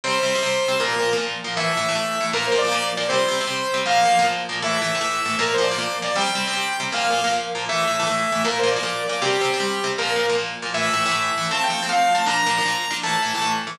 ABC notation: X:1
M:6/8
L:1/16
Q:3/8=157
K:Aphr
V:1 name="Lead 2 (sawtooth)"
c12 | B6 z6 | e12 | B2 c2 d6 d2 |
c12 | f6 z6 | e12 | B2 c2 d6 d2 |
g12 | f6 z6 | e12 | B2 c2 d6 d2 |
G12 | B4 z8 | e12 | a2 g4 f4 a2 |
b12 | a8 z4 |]
V:2 name="Overdriven Guitar"
[C,G,C]3 [C,G,C]2 [C,G,C] [C,G,C]4 [C,G,C]2 | [B,,F,B,]3 [B,,F,B,]2 [B,,F,B,] [B,,F,B,]4 [B,,F,B,]2 | [A,,E,A,]3 [A,,E,A,]2 [A,,E,A,] [A,,E,A,]4 [A,,E,A,]2 | [B,,F,B,]3 [B,,F,B,]2 [B,,F,B,] [B,,F,B,]4 [B,,F,B,]2 |
[C,G,C]3 [C,G,C]2 [C,G,C] [C,G,C]4 [C,G,C]2 | [B,,F,B,]3 [B,,F,B,]2 [B,,F,B,] [B,,F,B,]4 [B,,F,B,]2 | [A,,E,A,]3 [A,,E,A,]2 [A,,E,A,] [A,,E,A,]4 [A,,E,A,]2 | [B,,F,B,]3 [B,,F,B,]2 [B,,F,B,] [B,,F,B,]4 [B,,F,B,]2 |
[C,G,C]3 [C,G,C]2 [C,G,C] [C,G,C]4 [C,G,C]2 | [B,,F,B,]3 [B,,F,B,]2 [B,,F,B,] [B,,F,B,]4 [B,,F,B,]2 | [A,,E,A,]3 [A,,E,A,]2 [A,,E,A,] [A,,E,A,]4 [A,,E,A,]2 | [B,,F,B,]3 [B,,F,B,]2 [B,,F,B,] [B,,F,B,]4 [B,,F,B,]2 |
[C,G,C]3 [C,G,C]2 [C,G,C] [C,G,C]4 [C,G,C]2 | [B,,F,B,]3 [B,,F,B,]2 [B,,F,B,] [B,,F,B,]4 [B,,F,B,]2 | [A,,E,A,]3 [A,,E,A,]2 [A,,E,A,] [A,,E,A,]4 [A,,E,A,]2 | [F,A,C]3 [F,A,C]2 [F,A,C] [F,A,C]4 [F,A,C]2 |
[B,,F,D]3 [B,,F,D]2 [B,,F,D] [B,,F,D]4 [B,,F,D]2 | [A,,E,A,]3 [A,,E,A,]2 [A,,E,A,] [A,,E,A,]4 [A,,E,A,]2 |]